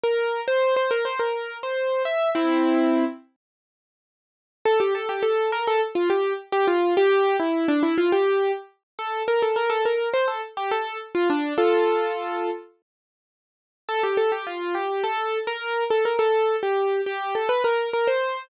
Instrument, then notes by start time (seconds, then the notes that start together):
acoustic grand piano
0.03 A#4
0.48 C5
0.76 C5
0.91 A#4
1.05 C5
1.19 A#4
1.63 C5
2.05 E5
2.35 C4 E4
4.65 A4
4.80 G4
4.95 A4
5.09 G4
5.23 A4
5.52 A#4
5.67 A4
5.95 F4
6.10 G4
6.52 G4
6.67 F4
6.97 G4
7.40 E4
7.68 D4
7.83 E4
7.98 F4
8.12 G4
8.99 A4
9.28 A#4
9.42 A4
9.56 A#4
9.70 A4
9.85 A#4
10.13 C5
10.28 A4
10.57 G4
10.71 A4
11.15 F4
11.30 D4
11.58 F4 A4
13.89 A4
14.03 G4
14.17 A4
14.32 G4
14.47 F4
14.75 G4
15.04 A4
15.47 A#4
15.90 A4
16.05 A#4
16.19 A4
16.63 G4
17.06 G4
17.35 A4
17.49 B4
17.64 A#4
17.93 A#4
18.07 C5